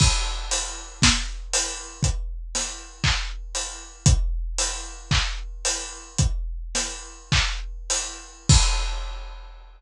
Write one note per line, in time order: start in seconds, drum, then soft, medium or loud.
0.00 kick medium
0.00 crash loud
0.51 open hi-hat medium
1.02 kick medium
1.02 snare loud
1.53 open hi-hat medium
2.03 kick medium
2.03 closed hi-hat medium
2.55 snare soft
2.55 open hi-hat medium
3.04 kick medium
3.04 clap loud
3.55 open hi-hat medium
4.06 kick loud
4.06 closed hi-hat loud
4.58 open hi-hat medium
5.11 kick medium
5.11 clap medium
5.65 open hi-hat medium
6.18 kick medium
6.18 closed hi-hat medium
6.75 snare medium
6.75 open hi-hat medium
7.32 kick medium
7.32 clap loud
7.90 open hi-hat medium
8.49 kick loud
8.49 crash loud